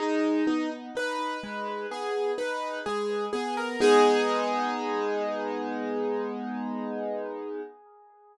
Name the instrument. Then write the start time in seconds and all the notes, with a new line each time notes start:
acoustic grand piano
0.00 G#3 D#4
0.47 B3 D#4
0.95 D#4 B4
1.43 G#3
1.91 B3 G#4
2.38 D#4 B4
2.86 G#3 G#4
3.33 B3 G#4
3.57 A#4
3.80 G#3 B3 D#4 G#4